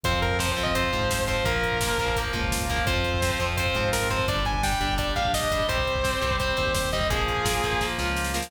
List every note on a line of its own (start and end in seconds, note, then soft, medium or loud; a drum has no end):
0.03 0.48 F2 medium
0.03 0.37 F3 medium
0.03 1.43 C4 medium
0.03 0.37 C4 medium
0.03 1.43 F4 medium
0.03 0.19 C5 medium
0.03 kick medium
0.03 closed hi-hat medium
0.14 kick medium
0.22 0.37 A#4 medium
0.22 kick medium
0.22 closed hi-hat medium
0.31 kick medium
0.39 0.55 F3 medium
0.39 0.55 C4 medium
0.39 0.51 C5 medium
0.39 kick medium
0.39 snare loud
0.48 0.63 C5 medium
0.48 kick medium
0.57 0.88 F2 medium
0.57 0.73 F3 medium
0.57 0.73 C4 medium
0.57 kick medium
0.57 closed hi-hat medium
0.63 0.74 D#5 medium
0.63 kick medium
0.75 0.91 F3 medium
0.75 0.91 C4 medium
0.75 1.23 C5 medium
0.75 kick medium
0.75 closed hi-hat loud
0.84 kick medium
0.93 1.38 G#2 medium
0.93 1.25 F3 medium
0.93 1.25 C4 medium
0.93 kick medium
0.93 closed hi-hat medium
1.01 kick medium
1.10 kick medium
1.10 snare loud
1.19 kick medium
1.27 1.43 F3 medium
1.27 1.43 C4 medium
1.27 1.44 C5 medium
1.27 kick medium
1.27 closed hi-hat medium
1.37 kick medium
1.44 1.89 A#1 loud
1.44 1.78 F3 medium
1.44 1.78 A#3 medium
1.44 2.84 A#3 medium
1.44 2.84 F4 medium
1.44 2.18 A#4 medium
1.44 kick loud
1.44 closed hi-hat medium
1.55 kick medium
1.63 kick medium
1.63 closed hi-hat medium
1.72 kick medium
1.81 1.98 F3 medium
1.81 1.98 A#3 medium
1.81 kick medium
1.81 snare loud
1.90 kick medium
1.98 2.28 A#1 medium
1.98 2.16 F3 medium
1.98 2.16 A#3 medium
1.98 kick medium
1.98 closed hi-hat medium
2.08 kick medium
2.16 2.32 F3 medium
2.16 2.33 A#3 medium
2.16 kick medium
2.16 closed hi-hat loud
2.25 kick medium
2.33 2.79 C#2 medium
2.33 2.66 F3 medium
2.33 2.66 A#3 medium
2.33 kick medium
2.33 closed hi-hat medium
2.43 kick medium
2.51 kick medium
2.51 snare loud
2.60 kick medium
2.69 2.86 F3 medium
2.69 2.86 A#3 medium
2.69 kick medium
2.69 closed hi-hat medium
2.78 kick medium
2.86 3.31 F2 loud
2.86 3.20 F3 medium
2.86 4.25 C4 medium
2.86 3.20 C4 medium
2.86 4.25 F4 medium
2.86 3.45 C5 medium
2.86 kick loud
2.86 closed hi-hat medium
2.96 kick medium
3.04 kick medium
3.04 closed hi-hat medium
3.14 kick medium
3.22 3.39 F3 medium
3.22 3.39 C4 medium
3.22 kick medium
3.22 snare loud
3.31 kick medium
3.39 3.69 F2 medium
3.39 3.56 F3 medium
3.39 3.56 C4 medium
3.39 kick medium
3.39 closed hi-hat medium
3.49 kick medium
3.57 3.75 F3 medium
3.57 3.75 C4 medium
3.57 3.89 C5 medium
3.57 kick medium
3.57 closed hi-hat loud
3.66 kick medium
3.75 4.20 G#2 medium
3.75 4.08 F3 medium
3.75 4.08 C4 medium
3.75 kick medium
3.75 closed hi-hat medium
3.84 kick medium
3.92 4.08 A#4 medium
3.92 kick medium
3.92 snare loud
4.02 kick medium
4.10 4.26 F3 medium
4.10 4.26 C4 medium
4.10 4.27 C5 medium
4.10 kick medium
4.10 closed hi-hat medium
4.19 kick medium
4.28 4.73 G1 loud
4.28 4.61 G3 medium
4.28 5.66 D4 medium
4.28 4.61 D4 medium
4.28 5.66 G4 medium
4.28 4.45 D5 medium
4.28 kick medium
4.28 closed hi-hat medium
4.37 kick medium
4.45 4.62 G#5 medium
4.45 kick medium
4.45 closed hi-hat medium
4.54 kick medium
4.63 4.79 G3 medium
4.63 4.79 D4 medium
4.63 4.94 G5 medium
4.63 kick medium
4.63 snare loud
4.73 kick medium
4.81 5.11 G1 medium
4.81 4.97 G3 medium
4.81 4.97 D4 medium
4.81 kick medium
4.81 closed hi-hat medium
4.89 kick medium
4.98 5.14 G3 medium
4.98 5.14 D4 medium
4.98 5.13 D5 medium
4.98 kick medium
4.98 closed hi-hat medium
5.07 kick medium
5.16 5.61 A#1 medium
5.16 5.49 G3 medium
5.16 5.49 D4 medium
5.16 5.31 F5 medium
5.16 kick medium
5.16 closed hi-hat medium
5.25 kick medium
5.33 5.67 D#5 medium
5.33 kick medium
5.33 snare loud
5.43 kick medium
5.51 5.68 G3 medium
5.51 5.68 D4 medium
5.51 kick medium
5.51 closed hi-hat medium
5.60 kick medium
5.68 6.13 C2 medium
5.68 6.01 G3 medium
5.68 7.07 C4 medium
5.68 6.01 C4 medium
5.68 7.07 G4 medium
5.68 6.36 C5 medium
5.68 kick medium
5.68 closed hi-hat medium
5.78 kick medium
5.87 kick medium
5.87 closed hi-hat medium
5.96 kick medium
6.04 6.20 G3 medium
6.04 6.20 C4 medium
6.04 kick medium
6.04 snare medium
6.13 kick medium
6.21 6.53 C2 medium
6.21 6.38 G3 medium
6.21 6.38 C4 medium
6.21 kick medium
6.21 closed hi-hat medium
6.31 kick medium
6.40 6.56 G3 medium
6.40 6.57 C4 medium
6.40 6.73 C5 medium
6.40 kick medium
6.40 closed hi-hat medium
6.49 kick medium
6.57 7.04 D#2 medium
6.57 6.89 G3 medium
6.57 6.89 C4 medium
6.57 kick medium
6.57 closed hi-hat medium
6.66 kick medium
6.74 6.89 C5 medium
6.74 kick medium
6.74 snare loud
6.84 kick medium
6.92 7.10 G3 medium
6.92 7.10 C4 medium
6.92 7.08 D#5 medium
6.92 kick medium
6.92 closed hi-hat medium
7.01 kick medium
7.10 7.55 A#1 medium
7.10 7.43 F3 medium
7.10 8.49 A#3 medium
7.10 7.43 A#3 medium
7.10 8.49 F4 medium
7.10 7.85 G#4 medium
7.10 kick medium
7.10 closed hi-hat loud
7.19 kick medium
7.28 kick medium
7.28 closed hi-hat medium
7.37 kick medium
7.45 7.61 F3 medium
7.45 7.61 A#3 medium
7.45 kick medium
7.45 snare loud
7.54 kick medium
7.63 7.93 A#1 medium
7.63 7.80 F3 medium
7.63 7.80 A#3 medium
7.63 kick medium
7.63 closed hi-hat medium
7.73 kick medium
7.81 7.97 F3 medium
7.81 7.97 A#3 medium
7.81 kick medium
7.81 snare medium
7.98 8.43 C#2 medium
7.98 8.32 F3 medium
7.98 8.32 A#3 medium
7.98 snare medium
8.16 snare medium
8.24 snare medium
8.34 8.50 F3 medium
8.34 8.50 A#3 medium
8.34 snare medium
8.42 snare loud